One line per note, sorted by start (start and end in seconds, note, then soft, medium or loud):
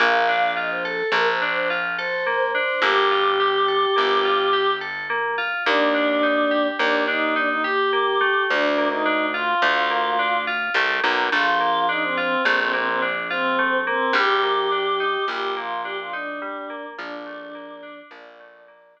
0.00 1.03 A#1 loud
0.00 0.25 A#3 loud
0.00 0.51 F5 loud
0.28 0.54 D4 loud
0.56 0.82 F4 medium
0.56 0.70 D#5 medium
0.71 0.84 C5 medium
0.83 1.07 A4 loud
0.83 1.10 A4 medium
1.12 2.68 A#1 medium
1.12 1.39 A#3 medium
1.12 1.27 A#4 loud
1.27 1.41 C5 loud
1.42 1.67 D4 medium
1.42 1.55 C5 medium
1.55 1.69 C5 loud
1.70 1.96 F4 medium
1.98 2.24 A4 medium
1.98 2.49 C5 medium
2.26 2.52 A#3 loud
2.53 2.80 D4 medium
2.53 2.81 C5 medium
2.82 3.86 G1 loud
2.82 3.08 A#3 loud
2.82 4.70 G4 loud
3.11 3.37 F4 medium
3.40 3.65 G4 medium
3.68 3.93 A4 medium
3.96 5.54 G1 medium
3.96 4.21 A#3 medium
4.24 4.50 F4 medium
4.53 4.78 G4 medium
4.81 5.06 A4 medium
5.10 5.35 A#3 loud
5.38 5.63 F4 medium
5.66 6.71 D#2 loud
5.66 5.92 A#3 loud
5.66 6.67 D4 loud
5.94 6.20 D4 medium
6.23 6.48 D#4 medium
6.51 6.76 G4 medium
6.79 8.36 D#2 medium
6.79 7.05 A#3 medium
6.79 7.03 D4 loud
7.07 7.33 D4 loud
7.07 7.35 D#4 loud
7.35 7.49 D4 loud
7.35 7.61 D#4 medium
7.49 7.63 D#4 loud
7.63 8.44 G4 medium
7.63 7.90 G4 medium
7.93 8.18 A#3 loud
8.21 8.74 A3 loud
8.49 9.54 D2 loud
8.49 8.88 D4 loud
8.77 9.03 A#3 medium
8.90 9.26 D#4 loud
9.05 9.31 D4 medium
9.34 9.59 F4 medium
9.34 10.37 F4 medium
9.62 10.70 D2 loud
9.62 9.88 A3 loud
9.90 10.16 A#3 medium
10.19 10.44 D4 medium
10.47 10.73 F4 loud
10.74 11.00 C2 medium
10.74 11.01 A3 medium
11.04 11.29 B1 medium
11.04 11.29 A#3 medium
11.32 12.37 A#1 loud
11.32 11.58 A3 loud
11.32 11.86 F4 loud
11.60 11.86 A#3 medium
11.89 12.14 D4 loud
11.89 12.02 D#4 medium
12.03 12.17 C4 loud
12.17 12.42 C4 loud
12.17 12.43 F4 medium
12.45 14.01 A#1 medium
12.45 12.71 A3 loud
12.45 12.58 C4 loud
12.59 12.72 C4 loud
12.73 12.99 A#3 medium
12.73 12.87 C4 loud
12.88 13.01 C4 loud
13.02 13.27 D4 medium
13.30 13.77 C4 loud
13.30 13.56 F4 medium
13.59 13.84 A3 loud
13.87 14.12 A#3 loud
13.87 14.13 C4 loud
14.13 15.17 A#1 loud
14.13 14.40 G3 loud
14.13 15.25 G4 loud
14.43 14.69 A#3 medium
14.72 14.97 D4 medium
15.00 15.25 D#4 loud
15.28 16.84 A#1 medium
15.28 15.54 G3 medium
15.28 15.54 G4 medium
15.56 15.82 A#3 medium
15.56 15.81 F4 loud
15.83 16.10 D4 medium
15.83 15.97 G4 loud
15.99 16.13 F4 loud
16.12 16.85 D4 medium
16.12 16.39 D#4 medium
16.42 16.67 G3 loud
16.70 16.95 A#3 medium
16.98 18.03 A#1 loud
16.98 17.24 F3 loud
16.98 17.99 D4 loud
17.26 17.52 A3 medium
17.55 17.80 A#3 medium
17.83 18.08 D4 loud
18.11 19.00 A#1 medium
18.11 18.37 F3 loud
18.11 19.00 D5 medium
18.40 18.65 A3 medium
18.68 18.93 A#3 medium
18.96 19.00 D4 medium